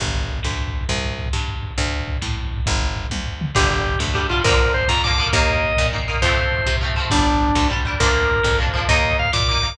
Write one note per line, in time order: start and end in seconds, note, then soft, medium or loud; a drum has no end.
0.00 0.40 G1 medium
0.00 kick medium
0.00 crash medium
0.08 kick medium
0.15 kick medium
0.15 closed hi-hat medium
0.24 kick medium
0.28 kick medium
0.28 closed hi-hat medium
0.38 kick medium
0.43 0.84 D2 medium
0.43 kick medium
0.43 snare medium
0.51 kick medium
0.58 kick medium
0.58 closed hi-hat medium
0.67 kick medium
0.73 kick medium
0.73 closed hi-hat medium
0.81 kick medium
0.89 1.29 C2 loud
0.89 kick medium
0.89 closed hi-hat medium
0.96 kick medium
1.04 kick medium
1.04 closed hi-hat medium
1.10 kick medium
1.18 kick medium
1.18 closed hi-hat medium
1.26 kick medium
1.33 1.73 G2 medium
1.33 kick medium
1.33 snare medium
1.41 kick medium
1.48 kick medium
1.48 closed hi-hat medium
1.56 kick medium
1.63 kick medium
1.63 closed hi-hat medium
1.71 kick medium
1.78 2.18 D2 loud
1.78 kick medium
1.78 closed hi-hat medium
1.85 kick medium
1.91 kick medium
1.91 closed hi-hat medium
2.00 kick medium
2.07 kick medium
2.07 closed hi-hat medium
2.16 kick medium
2.21 2.62 A2 medium
2.21 kick medium
2.21 snare medium
2.29 kick medium
2.36 kick medium
2.36 closed hi-hat medium
2.45 kick medium
2.52 kick medium
2.52 closed hi-hat medium
2.58 kick medium
2.66 3.07 G1 loud
2.66 kick medium
2.66 closed hi-hat medium
2.75 kick medium
2.80 kick medium
2.80 closed hi-hat medium
2.89 kick medium
2.96 kick medium
2.96 closed hi-hat medium
3.05 kick medium
3.10 3.51 D2 medium
3.10 kick medium
3.10 high tom medium
3.26 floor tom medium
3.41 mid tom loud
3.55 3.96 G1 loud
3.55 4.09 D3 medium
3.55 4.09 G3 medium
3.55 3.69 G4 medium
3.55 kick loud
3.55 crash medium
3.62 kick medium
3.70 3.99 G4 medium
3.70 kick medium
3.70 closed hi-hat medium
3.78 kick medium
3.86 kick medium
3.86 closed hi-hat medium
3.94 kick medium
3.99 4.40 D2 medium
3.99 kick medium
3.99 snare loud
4.08 kick medium
4.14 4.27 D3 medium
4.14 4.27 G3 medium
4.14 4.27 G4 medium
4.14 kick medium
4.14 closed hi-hat medium
4.23 kick medium
4.29 4.43 D3 medium
4.29 4.43 G3 medium
4.29 4.42 F4 medium
4.29 kick medium
4.29 closed hi-hat medium
4.37 kick medium
4.44 4.84 A#1 loud
4.44 4.99 D3 medium
4.44 4.99 F3 medium
4.44 4.99 A#3 medium
4.44 4.73 A#4 medium
4.44 kick loud
4.44 closed hi-hat loud
4.51 kick medium
4.58 kick medium
4.58 closed hi-hat medium
4.66 kick medium
4.74 4.88 C5 medium
4.74 kick medium
4.74 closed hi-hat medium
4.80 kick medium
4.88 5.29 F2 medium
4.88 5.02 A#5 medium
4.88 kick medium
4.88 snare loud
4.97 kick medium
5.02 5.17 D3 medium
5.02 5.17 F3 medium
5.02 5.28 D6 medium
5.02 kick medium
5.02 closed hi-hat medium
5.07 5.17 A#3 medium
5.07 kick medium
5.18 5.31 D3 medium
5.18 5.31 F3 medium
5.18 5.31 A#3 medium
5.18 kick medium
5.18 closed hi-hat medium
5.27 kick medium
5.32 5.73 D#2 loud
5.32 5.87 D#3 loud
5.32 5.87 A#3 medium
5.32 5.87 D#5 medium
5.32 kick medium
5.32 closed hi-hat loud
5.40 kick medium
5.48 kick medium
5.48 closed hi-hat medium
5.55 kick medium
5.63 kick medium
5.63 closed hi-hat medium
5.69 kick medium
5.77 6.18 A#2 medium
5.77 kick medium
5.77 snare loud
5.86 kick medium
5.93 6.07 D#3 medium
5.93 6.07 A#3 medium
5.93 kick medium
5.93 closed hi-hat medium
5.99 kick medium
6.07 6.21 D#3 medium
6.07 6.21 A#3 medium
6.07 kick medium
6.07 closed hi-hat medium
6.15 kick medium
6.22 6.62 F2 medium
6.22 6.76 F3 medium
6.22 6.76 A3 medium
6.22 6.76 C4 medium
6.22 6.76 C5 medium
6.22 kick medium
6.22 closed hi-hat loud
6.29 kick medium
6.37 kick medium
6.37 closed hi-hat medium
6.43 kick medium
6.52 kick medium
6.52 closed hi-hat medium
6.58 kick medium
6.66 7.06 C3 medium
6.66 kick medium
6.66 snare loud
6.75 kick medium
6.80 6.95 F3 medium
6.80 6.95 A3 medium
6.80 kick medium
6.80 closed hi-hat medium
6.85 6.95 C4 medium
6.89 kick medium
6.95 7.10 F3 medium
6.95 7.10 A3 medium
6.95 kick medium
6.95 closed hi-hat medium
7.00 7.10 C4 medium
7.05 kick medium
7.10 7.52 G1 loud
7.10 7.65 G3 medium
7.10 7.68 D4 medium
7.10 7.65 D4 medium
7.10 kick medium
7.10 closed hi-hat loud
7.18 kick medium
7.26 kick medium
7.26 closed hi-hat medium
7.34 kick medium
7.40 kick medium
7.40 closed hi-hat medium
7.49 kick medium
7.55 7.95 D2 medium
7.55 kick medium
7.55 snare loud
7.63 kick medium
7.69 7.83 G3 medium
7.69 7.83 D4 medium
7.69 kick medium
7.69 closed hi-hat medium
7.77 kick medium
7.85 7.99 G3 medium
7.85 7.99 D4 medium
7.85 kick medium
7.85 closed hi-hat medium
7.93 kick medium
8.00 8.40 D2 loud
8.00 8.55 F3 medium
8.00 8.55 A#3 medium
8.00 8.55 D4 medium
8.00 8.58 A#4 medium
8.00 kick loud
8.00 closed hi-hat loud
8.07 kick medium
8.15 kick medium
8.15 closed hi-hat medium
8.23 kick medium
8.29 kick medium
8.29 closed hi-hat medium
8.36 kick medium
8.43 8.84 F2 medium
8.43 kick medium
8.43 snare loud
8.52 kick medium
8.58 8.72 F3 medium
8.58 8.72 A#3 medium
8.58 8.72 D4 medium
8.58 kick medium
8.58 closed hi-hat medium
8.67 kick medium
8.74 8.87 F3 medium
8.74 8.87 A#3 medium
8.74 8.87 D4 medium
8.74 kick medium
8.74 closed hi-hat medium
8.81 kick medium
8.89 9.29 D#2 loud
8.89 9.43 A#3 medium
8.89 9.43 D#4 loud
8.89 9.17 D#5 medium
8.89 kick loud
8.89 closed hi-hat loud
8.96 kick medium
9.04 kick medium
9.04 closed hi-hat medium
9.11 kick medium
9.19 9.31 F5 medium
9.19 kick medium
9.19 closed hi-hat medium
9.25 kick medium
9.32 9.73 A#2 medium
9.32 9.47 D6 medium
9.32 kick medium
9.32 snare loud
9.40 kick medium
9.47 9.63 A#3 medium
9.47 9.63 D#4 medium
9.47 9.74 D6 medium
9.47 kick medium
9.47 closed hi-hat medium
9.56 kick medium
9.63 9.77 A#3 medium
9.63 9.77 D#4 medium
9.63 kick medium
9.63 closed hi-hat medium
9.70 kick medium